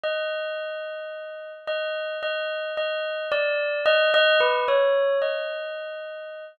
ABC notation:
X:1
M:2/4
L:1/16
Q:1/4=55
K:none
V:1 name="Tubular Bells"
_e6 e2 | _e2 e2 d2 e e | B _d2 _e5 |]